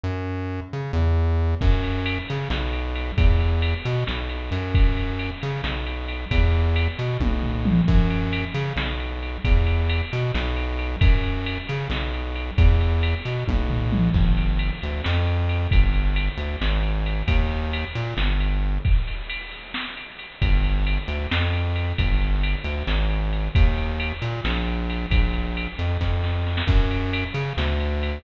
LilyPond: <<
  \new Staff \with { instrumentName = "Synth Bass 1" } { \clef bass \time 7/8 \key fis \phrygian \tempo 4 = 134 fis,4. cis8 e,4. | fis,4. cis8 b,,4. | e,4. b,8 b,,4 fis,8~ | fis,4. cis8 b,,4. |
e,4. b,8 b,,4. | fis,4. cis8 b,,4. | e,4. b,8 b,,4. | fis,4. cis8 b,,4. |
e,4. b,8 b,,4. | \key g \phrygian g,,4. d,8 f,4. | g,,4. d,8 aes,,4. | ees,4. bes,8 g,,4. |
r2. r8 | g,,4. d,8 f,4. | g,,4. d,8 aes,,4. | ees,4. bes,8 bes,,4. |
bes,,4. f,8 f,4. | \key fis \phrygian fis,4. cis8 d,4. | }
  \new DrumStaff \with { instrumentName = "Drums" } \drummode { \time 7/8 r4 r4 r4. | <cymc bd>8 cymr8 cymr8 cymr8 sn8 cymr8 cymr8 | <bd cymr>8 cymr8 cymr8 cymr8 sn8 cymr8 cymr8 | <bd cymr>8 cymr8 cymr8 cymr8 sn8 cymr8 cymr8 |
<bd cymr>4 cymr8 cymr8 <bd tommh>8 tomfh8 toml8 | <cymc bd>8 cymr8 cymr8 cymr8 sn8 cymr8 cymr8 | <bd cymr>8 cymr8 cymr8 cymr8 sn8 cymr8 cymr8 | <bd cymr>8 cymr8 cymr8 cymr8 sn8 cymr8 cymr8 |
<bd cymr>8 cymr8 cymr8 cymr8 <bd tommh>8 tomfh8 toml8 | <cymc bd>8 cymr8 cymr8 cymr8 sn8 cymr8 cymr8 | <bd cymr>8 cymr8 cymr8 cymr8 sn8 cymr8 cymr8 | <bd cymr>8 cymr8 cymr8 cymr8 sn8 cymr4 |
<bd cymr>8 cymr8 cymr8 cymr8 sn8 cymr8 cymr8 | <bd cymr>8 cymr8 cymr8 cymr8 sn8 cymr8 cymr8 | <bd cymr>8 cymr8 cymr8 cymr8 sn8 cymr8 cymr8 | <bd cymr>8 cymr8 cymr8 cymr8 sn8 cymr8 cymr8 |
<bd cymr>8 cymr8 cymr8 cymr8 <bd sn>8 sn8 sn16 sn16 | <cymc bd>8 cymr8 cymr8 cymr8 sn8 cymr8 cymr8 | }
>>